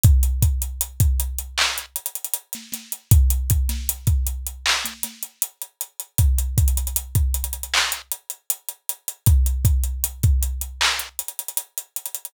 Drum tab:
HH |x-x-x-x-x-x-x-x---x-xxxxx-x-x-x-|x-x-x-x-x-x-x-x---x-x-x-x-x-x-x-|x-x-xxxxx-x-xxxx--x-x-x-x-x-x-x-|x-x-x-x-x-x-x-x---x-xxxxx-x-xxxx|
CP |----------------x---------------|----------------x---------------|----------------x---------------|----------------x---------------|
SD |--------------------------o-o---|------o-----------o-o-----------|--------------------------------|--------------------------------|
BD |o---o-----o---------------------|o---o-----o---------------------|o---o-----o---------------------|o---o-----o---------------------|